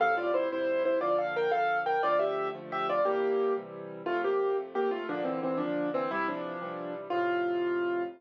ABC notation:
X:1
M:6/8
L:1/8
Q:3/8=118
K:F
V:1 name="Acoustic Grand Piano"
[Af] [Fd] [Ec] [Ec]2 [Ec] | [Fd] [Af] [Bg] [Af]2 [Bg] | [Fd] [Ge]2 z [Ge] [Fd] | [B,G]3 z3 |
[A,F] [B,G]2 z [B,G] [A,F] | [F,D] [E,C] [E,C] [F,D]2 [E,C] | [G,E] [F,D]4 z | F6 |]
V:2 name="Acoustic Grand Piano"
[F,,A,,C,G,]3 [F,,A,,C,G,]3 | [B,,D,F,]3 [B,,D,F,]3 | [D,F,A,]3 [D,F,A,]3 | [C,E,G,]3 [C,E,G,]3 |
[F,,C,]3 [F,,C,A,]3 | [B,,D,]3 [B,,D,]3 | [C,E,]3 [C,E,G,]3 | [F,,A,,C,]6 |]